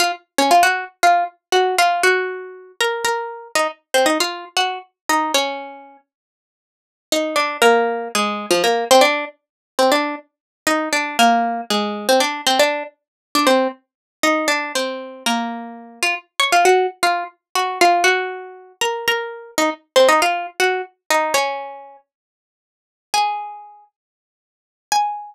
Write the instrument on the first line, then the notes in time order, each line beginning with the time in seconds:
pizzicato strings
0.00 F4 F5
0.38 C#4 C#5
0.51 F4 F5
0.63 F#4 F#5
1.03 F4 F5
1.52 F#4 F#5
1.78 F4 F5
2.03 F#4 F#5
2.81 A#4 A#5
3.05 A#4 A#5
3.55 D#4 D#5
3.94 C4 C5
4.06 D#4 D#5
4.20 F4 F5
4.57 F#4 F#5
5.09 D#4 D#5
5.34 C#4 C#5
7.12 D#4 D#5
7.36 D4 D5
7.62 A#3 A#4
8.15 G#3 G#4
8.51 F3 F4
8.64 A#3 A#4
8.91 C4 C5
9.01 D4 D5
9.79 C4 C5
9.92 D4 D5
10.67 D#4 D#5
10.93 D4 D5
11.19 A#3 A#4
11.70 G#3 G#4
12.09 C4 C5
12.20 D4 D5
12.47 C4 C5
12.59 D4 D5
13.35 D4 D5
13.47 C4 C5
14.23 D#4 D#5
14.48 D4 D5
14.75 C4 C5
15.26 A#3 A#4
16.03 F4 F5
16.40 C#5 C#6
16.52 F4 F5
16.65 F#4 F#5
17.03 F4 F5
17.55 F#4 F#5
17.81 F4 F5
18.04 F#4 F#5
18.81 A#4 A#5
19.08 A#4 A#5
19.58 D#4 D#5
19.96 C4 C5
20.09 D#4 D#5
20.22 F4 F5
20.60 F#4 F#5
21.10 D#4 D#5
21.34 C#4 C#5
23.14 G#4 G#5
24.92 G#5